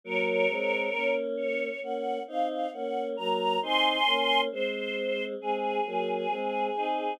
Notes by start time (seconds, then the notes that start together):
0.04 F#3 A#3 A#4 C#5
0.49 G#3 C4
0.93 A#3 C#4
1.37 C#5
1.82 A#3 C#4 F#5
2.27 C4 D#4 F5
2.49 F5
2.73 A#3 C#4 F#5
3.17 F#3 A#3 A#5
3.62 C4 D#4 G#5 C6
4.06 A#3 C#4
4.52 G#3 C4 C5
5.40 G#3 C4 G#4
5.86 F#3 A#3
6.30 G#3 C4
6.76 C4 D#4